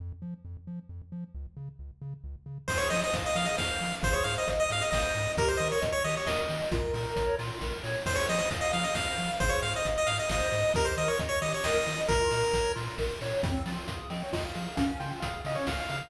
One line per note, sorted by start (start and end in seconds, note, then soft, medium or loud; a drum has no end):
0.00 0.12 F2 medium
0.22 0.34 F3 medium
0.45 0.57 F2 medium
0.67 0.80 F3 medium
0.89 1.02 F2 medium
1.12 1.24 F3 medium
1.35 1.47 C#2 medium
1.57 1.69 C#3 medium
1.79 1.91 C#2 medium
2.02 2.14 C#3 medium
2.24 2.36 C#2 medium
2.46 2.58 C#3 medium
2.68 2.81 F2 medium
2.68 2.89 G#4 medium
2.68 2.78 C5 loud
2.68 kick medium
2.68 crash loud
2.77 2.88 C#5 loud
2.90 3.03 F3 medium
2.90 3.10 C5 medium
2.90 3.01 D#5 loud
2.90 open hi-hat medium
3.03 3.14 D#5 loud
3.13 3.26 F2 medium
3.13 3.34 F5 medium
3.13 kick medium
3.13 closed hi-hat loud
3.26 3.37 D#5 loud
3.35 3.48 F3 medium
3.35 3.57 G#4 medium
3.35 3.47 F5 loud
3.35 open hi-hat medium
3.45 3.56 D#5 loud
3.57 3.71 F2 medium
3.57 3.78 C5 medium
3.57 3.95 F5 loud
3.57 kick medium
3.57 snare loud
3.81 3.93 F3 medium
3.81 4.01 F5 medium
3.81 open hi-hat medium
4.03 4.15 G#1 loud
4.03 4.23 G#4 loud
4.03 4.14 C5 loud
4.03 kick loud
4.03 closed hi-hat medium
4.13 4.24 C#5 loud
4.24 4.37 G#2 medium
4.24 4.46 C5 medium
4.24 4.35 F5 loud
4.24 open hi-hat medium
4.38 4.49 D#5 loud
4.48 4.60 G#1 medium
4.48 4.68 D#5 medium
4.48 kick medium
4.48 closed hi-hat medium
4.60 4.70 D#5 loud
4.70 4.82 G#2 medium
4.70 4.91 G#4 medium
4.70 4.83 F5 loud
4.70 open hi-hat medium
4.81 4.90 D#5 loud
4.90 5.04 G#1 medium
4.90 5.12 C5 medium
4.90 5.32 D#5 loud
4.90 kick medium
4.90 snare loud
5.15 5.27 G#2 medium
5.15 5.35 D#5 medium
5.15 open hi-hat medium
5.37 5.50 D#2 medium
5.37 5.58 G4 medium
5.37 5.49 A#4 loud
5.37 kick loud
5.37 closed hi-hat loud
5.48 5.59 C5 medium
5.57 5.72 D#3 medium
5.57 5.80 A#4 medium
5.57 5.68 D#5 loud
5.57 open hi-hat medium
5.72 5.82 C#5 medium
5.81 5.95 D#2 medium
5.81 6.01 D#5 medium
5.81 kick medium
5.81 closed hi-hat loud
5.92 6.03 C#5 loud
6.04 6.17 D#3 medium
6.04 6.26 G4 medium
6.04 6.15 D#5 loud
6.04 open hi-hat medium
6.17 6.28 C#5 medium
6.26 6.39 D#2 medium
6.26 6.47 A#4 medium
6.26 6.64 D#5 loud
6.26 kick medium
6.26 snare loud
6.49 6.61 D#3 medium
6.49 6.70 D#5 medium
6.49 open hi-hat medium
6.71 6.84 A#1 medium
6.71 6.91 F4 medium
6.71 7.36 A#4 loud
6.71 kick loud
6.71 closed hi-hat loud
6.94 7.06 A#2 medium
6.94 7.14 A#4 medium
6.94 open hi-hat medium
7.16 7.29 A#1 medium
7.16 7.36 C#5 medium
7.16 kick medium
7.16 closed hi-hat loud
7.38 7.51 A#2 medium
7.38 7.59 F4 medium
7.38 open hi-hat medium
7.61 7.74 A#1 medium
7.61 7.82 A#4 medium
7.61 kick medium
7.61 snare medium
7.83 7.96 A#2 medium
7.83 8.03 C#5 medium
7.83 open hi-hat medium
8.06 8.18 F2 medium
8.06 8.26 G#4 medium
8.06 8.17 C5 loud
8.06 kick medium
8.06 crash loud
8.15 8.26 C#5 loud
8.28 8.41 F3 medium
8.28 8.49 C5 medium
8.28 8.38 D#5 loud
8.28 open hi-hat medium
8.39 8.49 D#5 loud
8.50 8.63 F2 medium
8.50 8.70 F5 medium
8.50 kick medium
8.50 closed hi-hat loud
8.61 8.72 D#5 loud
8.73 8.86 F3 medium
8.73 8.93 G#4 medium
8.73 8.84 F5 loud
8.73 open hi-hat medium
8.84 8.94 D#5 loud
8.95 9.07 F2 medium
8.95 9.15 C5 medium
8.95 9.32 F5 loud
8.95 kick medium
8.95 snare loud
9.18 9.30 F3 medium
9.18 9.39 F5 medium
9.18 open hi-hat medium
9.40 9.53 G#1 loud
9.40 9.61 G#4 loud
9.40 9.51 C5 loud
9.40 kick loud
9.40 closed hi-hat medium
9.49 9.60 C#5 loud
9.62 9.75 G#2 medium
9.62 9.82 C5 medium
9.62 9.73 F5 loud
9.62 open hi-hat medium
9.76 9.87 D#5 loud
9.85 9.98 G#1 medium
9.85 10.07 D#5 medium
9.85 kick medium
9.85 closed hi-hat medium
9.98 10.08 D#5 loud
10.07 10.20 G#2 medium
10.07 10.27 G#4 medium
10.07 10.17 F5 loud
10.07 open hi-hat medium
10.19 10.30 D#5 loud
10.28 10.42 G#1 medium
10.28 10.49 C5 medium
10.28 10.72 D#5 loud
10.28 kick medium
10.28 snare loud
10.52 10.65 G#2 medium
10.52 10.72 D#5 medium
10.52 open hi-hat medium
10.74 10.87 D#2 medium
10.74 10.96 G4 medium
10.74 10.86 A#4 loud
10.74 kick loud
10.74 closed hi-hat loud
10.85 10.95 C5 medium
10.97 11.09 D#3 medium
10.97 11.18 A#4 medium
10.97 11.08 D#5 loud
10.97 open hi-hat medium
11.08 11.19 C#5 medium
11.19 11.32 D#2 medium
11.19 11.39 D#5 medium
11.19 kick medium
11.19 closed hi-hat loud
11.29 11.39 C#5 loud
11.42 11.54 D#3 medium
11.42 11.62 G4 medium
11.42 11.52 D#5 loud
11.42 open hi-hat medium
11.54 11.65 C#5 medium
11.64 11.76 D#2 medium
11.64 11.85 A#4 medium
11.64 12.01 D#5 loud
11.64 kick medium
11.64 snare loud
11.86 11.99 D#3 medium
11.86 12.06 D#5 medium
11.86 open hi-hat medium
12.08 12.21 A#1 medium
12.08 12.30 F4 medium
12.08 12.72 A#4 loud
12.08 kick loud
12.08 closed hi-hat loud
12.31 12.44 A#2 medium
12.31 12.51 A#4 medium
12.31 open hi-hat medium
12.53 12.66 A#1 medium
12.53 12.74 C#5 medium
12.53 kick medium
12.53 closed hi-hat loud
12.75 12.89 A#2 medium
12.75 12.96 F4 medium
12.75 open hi-hat medium
12.98 13.11 A#1 medium
12.98 13.19 A#4 medium
12.98 kick medium
12.98 snare medium
13.21 13.33 A#2 medium
13.21 13.42 C#5 medium
13.21 open hi-hat medium
13.42 13.56 F2 medium
13.42 13.63 C4 medium
13.42 13.52 F5 loud
13.42 kick loud
13.42 closed hi-hat loud
13.65 13.78 F3 medium
13.65 13.87 F4 medium
13.65 13.76 G5 loud
13.65 open hi-hat medium
13.87 14.00 F2 medium
13.87 14.10 G#4 medium
13.87 14.08 F5 medium
13.87 kick medium
13.87 closed hi-hat loud
14.10 14.23 F3 medium
14.10 14.30 C4 medium
14.10 14.21 D#5 medium
14.10 open hi-hat medium
14.23 14.34 C#5 loud
14.32 14.45 F2 medium
14.32 14.53 F4 medium
14.32 14.43 D#5 loud
14.32 kick medium
14.32 snare medium
14.45 14.56 F5 loud
14.55 14.68 F3 medium
14.55 14.75 G#4 medium
14.55 14.75 F5 loud
14.55 open hi-hat medium
14.75 14.90 C#2 medium
14.75 14.97 C#4 loud
14.75 14.86 F5 loud
14.75 kick medium
14.75 closed hi-hat loud
14.99 15.12 C#3 medium
14.99 15.20 F4 medium
14.99 15.10 G5 loud
14.99 open hi-hat medium
15.20 15.35 C#2 medium
15.20 15.43 G#4 medium
15.20 15.40 F5 loud
15.20 kick medium
15.20 closed hi-hat loud
15.45 15.57 C#3 medium
15.45 15.66 C#4 medium
15.45 15.57 D#5 medium
15.45 open hi-hat medium
15.55 15.66 C#5 medium
15.67 15.80 C#2 medium
15.67 15.87 F4 medium
15.67 15.78 F5 medium
15.67 kick medium
15.67 snare loud
15.80 15.90 F5 loud
15.89 16.02 C#3 medium
15.89 16.09 G#4 medium
15.89 16.09 F5 loud
15.89 open hi-hat medium